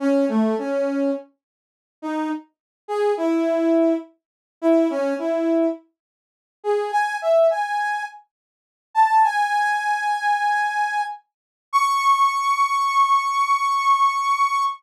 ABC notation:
X:1
M:4/4
L:1/8
Q:1/4=104
K:C#m
V:1 name="Brass Section"
C A, C2 z3 D | z2 G E3 z2 | E C E2 z3 G | g e g2 z3 a |
"^rit." g7 z | c'8 |]